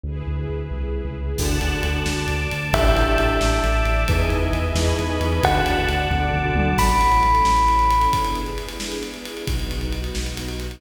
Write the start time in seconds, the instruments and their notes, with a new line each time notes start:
0.04 synth bass 2 D2, string ensemble 1 E4 G#4 B4
0.27 synth bass 2 D2
0.49 synth bass 2 D2
0.71 synth bass 2 C2
1.05 synth bass 2 C#2
1.37 synth bass 2 D2, glockenspiel D4 F#4 A4, string ensemble 1 D5 F#5 A5, kick, crash
1.60 synth bass 2 D2, glockenspiel D4 F#4 A4, ride
1.83 synth bass 2 D2, glockenspiel D4 F#4 A4, ride
2.06 synth bass 2 D2, string ensemble 1 D5 A5 D6, snare
2.28 synth bass 2 D2, ride
2.51 synth bass 2 D2, ride
2.73 synth bass 2 A1, glockenspiel D4 E4 G4 A4, string ensemble 1 D5 E5 G5 A5, tubular bells E5, kick, ride
2.96 synth bass 2 A1, glockenspiel D4 E4 G4 A4, ride
3.18 synth bass 2 A1, glockenspiel D4 E4 G4 A4, ride
3.40 synth bass 2 A1, string ensemble 1 D5 E5 A5 D6, snare
3.64 synth bass 2 A1, ride
3.85 synth bass 2 A1, ride
4.08 synth bass 2 E2, glockenspiel D#4 E4 G#4 B4, string ensemble 1 B4 D#5 E5 G#5, kick, ride
4.30 synth bass 2 E2, ride
4.53 synth bass 2 E2, ride
4.75 synth bass 2 E2, glockenspiel D#4 E4 G#4 B4, string ensemble 1 B4 D#5 G#5 B5, snare
4.99 synth bass 2 E2, ride
5.10 glockenspiel D#4 E4 G#4 B4
5.20 synth bass 2 E2, glockenspiel D#4 E4 G#4 B4, ride
5.43 synth bass 2 D2, glockenspiel D4 F#4 A4, string ensemble 1 D5 F#5 A5, tubular bells F#5, kick, ride
5.65 synth bass 2 D2, ride
5.89 synth bass 2 D2, ride
6.09 synth bass 2 D2, glockenspiel D4 F#4 A4, string ensemble 1 D5 A5 D6, kick, high tom
6.33 synth bass 2 D2, floor tom
6.45 glockenspiel D4 F#4 A4
6.55 synth bass 2 D2, glockenspiel D4 F#4 A4, mid tom
6.77 synth bass 2 A1, string ensemble 1 C#4 E4 A4, tubular bells B5, kick, crash
6.89 ride
7.01 ride
7.12 ride
7.23 ride
7.35 ride
7.45 synth bass 2 A1, snare
7.57 ride
7.68 ride
7.79 ride
7.91 ride
8.01 ride
8.11 string ensemble 1 B3 D4 E4 G#4, kick, ride
8.25 ride
8.35 ride
8.46 ride
8.58 ride
8.69 ride
8.80 snare
8.92 ride
9.03 ride
9.14 ride
9.25 ride
9.37 ride
9.46 synth bass 2 B1, string ensemble 1 B3 D#4 F#4, kick, ride
9.60 ride
9.71 ride
9.81 ride
9.93 ride
10.04 ride
10.15 synth bass 2 B1, snare
10.26 ride
10.37 ride
10.49 ride
10.60 ride
10.71 ride